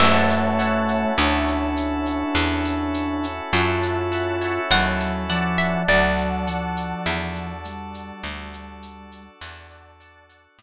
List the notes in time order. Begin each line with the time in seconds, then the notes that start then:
0.00 F#2 A3 C#4 E4 F#4 A4 C#5 E5 F#5 A5, crash
0.29 shaker
0.59 C#5 E5 F#5 A5, shaker
0.88 shaker
1.17 D2 D4, shaker
1.47 shaker
1.77 shaker
2.06 shaker
2.35 E2, shaker
2.65 shaker
2.94 shaker
3.24 shaker
3.53 F#2 F4 C#5 E5 F#5 A5, shaker
3.83 shaker
4.12 C#5 E5 F#5 A5, shaker
4.41 C#5 E5 F#5 A5, shaker
4.70 D#2 F#3 F#5, shaker
5.00 shaker
5.29 F3 D5 F#5 A5, shaker
5.58 E5, shaker
5.88 D2 F#3 D4 F#4 A4 D5 F#5 A5, shaker
6.18 shaker
6.47 F3 D5 F#5 A5, shaker
6.76 shaker
7.06 E2, shaker
7.35 shaker
7.65 G3, shaker
7.94 shaker
8.24 D2, shaker
8.53 shaker
8.82 shaker
9.12 shaker
9.41 E2 D5 F#5 A5, shaker
9.70 shaker
10.00 D5 F#5 A5, shaker
10.29 D5 F#5 A5, shaker
10.59 A2, shaker